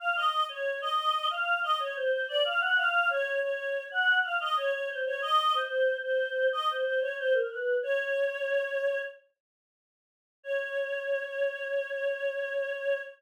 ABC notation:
X:1
M:4/4
L:1/16
Q:1/4=92
K:Db
V:1 name="Choir Aahs"
f e2 d2 e3 f2 e d c c =d f | g f2 d2 d3 g2 f e d d c d | e2 c3 c3 e c c d c B =B2 | d8 z8 |
d16 |]